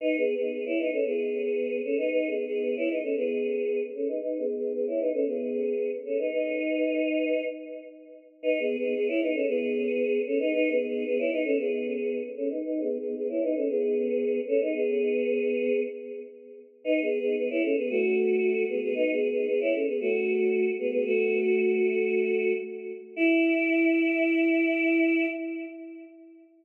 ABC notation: X:1
M:4/4
L:1/16
Q:1/4=114
K:E
V:1 name="Choir Aahs"
(3[DB]2 [B,G]2 [B,G]2 [B,G] [Ec] [DB] [CA] [B,G]6 [CA] [DB] | (3[DB]2 [B,G]2 [B,G]2 [B,G] [Ec] [DB] [CA] [B,G]6 [CA] [DB] | (3[DB]2 [B,G]2 [B,G]2 [B,G] [Ec] [DB] [CA] [B,G]6 [CA] [DB] | [DB]10 z6 |
(3[DB]2 [B,G]2 [B,G]2 [B,G] [Ec] [DB] [CA] [B,G]6 [CA] [DB] | (3[DB]2 [B,G]2 [B,G]2 [B,G] [Ec] [DB] [CA] [B,G]6 [CA] [DB] | (3[DB]2 [B,G]2 [B,G]2 [B,G] [Ec] [DB] [CA] [B,G]6 [CA] [DB] | [B,G]10 z6 |
(3[DB]2 [B,G]2 [B,G]2 [B,G] [Ec] [CA] [B,G] [A,F]6 [B,G] [B,G] | (3[DB]2 [B,G]2 [B,G]2 [B,G] [Ec] [CA] [B,G] [A,F]6 [B,G] [B,G] | [A,F]12 z4 | E16 |]